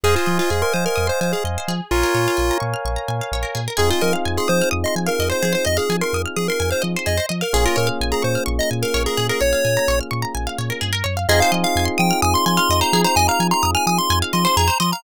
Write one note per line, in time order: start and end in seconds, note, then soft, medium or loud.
0.04 0.16 F2 medium
0.04 0.15 G#4 loud
0.04 0.15 G#4 medium
0.04 1.73 C5 medium
0.04 1.73 D#5 medium
0.04 1.73 F5 medium
0.04 1.73 G#5 medium
0.16 0.38 F4 medium
0.16 0.27 C5 medium
0.26 0.40 F3 medium
0.26 0.37 D#5 medium
0.39 0.50 F4 loud
0.39 0.50 F5 medium
0.50 0.63 F2 medium
0.50 0.62 G#4 medium
0.50 0.61 G#5 medium
0.62 0.73 A#4 medium
0.62 0.73 C6 medium
0.74 0.87 F3 medium
0.74 0.85 C5 medium
0.74 0.84 D#6 medium
0.86 1.08 A#4 medium
0.86 0.96 F6 medium
0.96 1.10 F2 medium
0.96 1.06 D#6 medium
1.07 1.20 C5 medium
1.07 1.18 C6 medium
1.21 1.34 F3 medium
1.21 1.32 C5 medium
1.21 1.32 G#5 medium
1.33 1.44 G#4 medium
1.33 1.44 F5 medium
1.44 1.57 F2 medium
1.44 1.56 D#5 medium
1.58 1.68 C5 medium
1.68 1.81 F3 medium
1.68 2.02 G#4 medium
1.91 2.04 A#1 medium
1.91 2.58 F4 loud
1.91 3.60 A#4 medium
1.91 3.60 C#5 medium
1.91 3.60 F5 medium
1.91 3.60 G#5 medium
2.03 2.14 A#4 medium
2.15 2.28 A#2 medium
2.15 2.25 C#5 medium
2.28 2.38 F5 medium
2.37 2.51 A#1 medium
2.37 2.48 G#5 medium
2.51 2.62 A#5 medium
2.60 2.75 A#2 medium
2.60 2.71 C#6 medium
2.74 2.84 F6 medium
2.85 2.98 A#1 medium
2.85 2.96 C#6 medium
2.96 3.07 A#5 medium
3.08 3.21 A#2 medium
3.08 3.19 G#5 medium
3.21 3.32 F5 medium
3.32 3.45 A#1 medium
3.32 3.44 C#5 medium
3.43 3.53 A#4 medium
3.55 3.68 A#2 medium
3.55 3.65 G#4 medium
3.68 3.78 A#4 medium
3.77 3.92 F2 medium
3.77 7.15 C4 medium
3.77 7.15 D#4 medium
3.77 7.15 F4 medium
3.77 3.87 G#4 medium
3.77 7.15 G#4 medium
3.77 3.90 G#4 loud
3.91 4.02 F4 loud
3.91 4.01 C5 medium
4.01 4.15 F3 medium
4.01 4.13 A#4 loud
4.01 4.12 D#5 medium
4.13 4.24 F5 medium
4.25 4.39 F2 medium
4.25 4.36 G#5 medium
4.37 4.49 G#4 medium
4.37 4.49 C6 medium
4.48 4.62 F3 medium
4.48 4.69 C5 loud
4.48 4.59 D#6 medium
4.62 4.72 F6 medium
4.71 4.85 F2 medium
4.71 4.82 D#6 medium
4.84 4.95 D#5 medium
4.84 4.96 C6 medium
4.96 5.09 F3 medium
4.96 5.07 G#5 medium
5.07 5.29 A#4 medium
5.07 5.17 F5 medium
5.19 5.32 F2 medium
5.19 5.30 D#5 medium
5.30 5.40 C5 medium
5.30 5.53 C5 loud
5.43 5.56 F3 medium
5.43 5.53 G#4 medium
5.53 5.63 C5 medium
5.53 5.66 C5 medium
5.65 5.79 F2 medium
5.65 5.75 D#5 medium
5.65 5.77 D#5 loud
5.77 5.97 G#4 medium
5.77 5.87 F5 medium
5.89 6.02 F3 medium
5.89 6.00 G#5 medium
6.01 6.22 A#4 medium
6.01 6.12 C6 medium
6.13 6.26 F2 medium
6.13 6.25 D#6 medium
6.26 6.36 F6 medium
6.37 6.49 F3 medium
6.37 6.48 G#4 medium
6.37 6.47 D#6 medium
6.48 6.70 A#4 medium
6.48 6.60 C6 medium
6.60 6.73 F2 medium
6.60 6.70 G#5 medium
6.71 6.83 C5 medium
6.71 6.81 F5 medium
6.82 6.96 F3 medium
6.82 6.92 D#5 medium
6.96 7.07 C5 medium
7.06 7.20 F2 medium
7.06 7.17 G#4 medium
7.06 7.26 D#5 medium
7.17 7.28 C5 medium
7.29 7.43 F3 medium
7.29 7.40 D#5 medium
7.41 7.53 A#4 medium
7.41 7.52 F5 medium
7.53 7.67 A#1 medium
7.53 10.91 A#3 medium
7.53 10.91 C#4 medium
7.53 10.91 F4 medium
7.53 10.91 G#4 medium
7.53 7.65 G#4 loud
7.65 7.77 F4 loud
7.65 7.76 A#4 medium
7.76 7.90 A#2 medium
7.76 7.89 A#4 loud
7.76 7.86 C#5 medium
7.87 7.98 F5 medium
8.01 8.13 A#1 medium
8.01 8.12 G#5 medium
8.12 8.23 G#4 medium
8.12 8.22 A#5 medium
8.22 8.37 A#2 medium
8.22 8.44 C5 medium
8.22 8.33 C#6 medium
8.35 8.46 F6 medium
8.46 8.60 A#1 medium
8.46 8.56 C#6 medium
8.59 8.70 D#5 medium
8.59 8.71 A#5 medium
8.71 8.84 A#2 medium
8.71 8.81 G#5 medium
8.82 9.03 A#4 medium
8.82 8.93 F5 medium
8.94 9.07 A#1 medium
8.94 9.05 C#5 medium
9.06 9.27 G#4 medium
9.06 9.17 A#4 medium
9.17 9.31 A#2 medium
9.17 9.28 G#4 medium
9.29 9.41 G#4 medium
9.29 9.40 A#4 medium
9.41 9.54 A#1 medium
9.41 9.51 C#5 medium
9.41 9.99 C#5 loud
9.53 9.63 F5 medium
9.65 9.78 A#2 medium
9.65 9.75 G#5 medium
9.77 9.88 A#5 medium
9.88 10.01 A#1 medium
9.88 9.99 C#6 medium
10.01 10.11 F6 medium
10.11 10.24 A#2 medium
10.11 10.21 C#6 medium
10.22 10.33 A#5 medium
10.35 10.48 A#1 medium
10.35 10.45 G#5 medium
10.47 10.57 F5 medium
10.58 10.71 A#2 medium
10.58 10.69 C#5 medium
10.70 10.81 A#4 medium
10.81 11.03 G2 medium
10.81 10.92 G#4 medium
10.93 11.03 A#4 medium
11.04 11.26 F#2 medium
11.04 11.14 C#5 medium
11.17 11.27 F5 medium
11.29 11.42 F2 medium
11.29 14.67 C4 medium
11.29 14.67 D#4 loud
11.29 14.67 F4 loud
11.29 14.67 G#4 loud
11.29 11.40 G#4 loud
11.29 11.40 D#5 loud
11.40 11.53 C5 medium
11.40 11.51 F5 loud
11.52 11.65 F3 medium
11.52 11.62 D#5 medium
11.64 11.85 F5 medium
11.64 11.75 F5 medium
11.75 11.88 F2 medium
11.75 11.88 G#5 medium
11.85 11.96 C6 medium
11.98 12.12 F3 medium
11.98 12.21 G5 medium
11.98 12.08 D#6 loud
12.11 12.21 F6 loud
12.22 12.35 F2 medium
12.22 12.34 G#5 loud
12.22 12.33 D#6 loud
12.34 12.45 C6 loud
12.34 12.46 C6 medium
12.46 12.59 F3 medium
12.46 12.57 G#5 medium
12.46 12.57 C6 medium
12.57 12.68 F5 loud
12.57 12.80 C6 loud
12.69 12.82 F2 medium
12.69 12.81 D#5 loud
12.81 12.92 C5 medium
12.81 13.02 A#5 loud
12.93 13.06 F3 medium
12.93 13.04 G#4 loud
13.04 13.15 C5 medium
13.04 13.16 A#5 loud
13.16 13.29 F2 medium
13.16 13.28 D#5 loud
13.16 13.27 G#5 loud
13.28 13.39 F5 medium
13.28 13.47 A#5 medium
13.40 13.53 F3 medium
13.40 13.51 G#5 medium
13.51 13.71 A#5 loud
13.51 13.62 C6 medium
13.63 13.76 F2 medium
13.63 13.73 D#6 medium
13.75 13.86 G#5 loud
13.75 13.85 F6 medium
13.87 13.99 F3 medium
13.87 13.98 G#5 loud
13.87 13.98 D#6 loud
13.98 14.19 C6 loud
13.98 14.09 C6 medium
14.10 14.23 F2 medium
14.10 14.21 G#5 medium
14.22 14.33 F5 medium
14.33 14.46 F3 medium
14.33 14.44 D#5 medium
14.33 14.45 C6 medium
14.45 14.55 C5 medium
14.45 14.56 C6 loud
14.57 14.70 F2 medium
14.57 14.68 G#4 loud
14.57 14.78 A#5 loud
14.68 14.78 C5 medium
14.80 14.93 F3 medium
14.80 14.90 D#5 medium
14.80 14.91 C6 medium
14.92 15.03 F5 medium
14.92 15.03 A#5 medium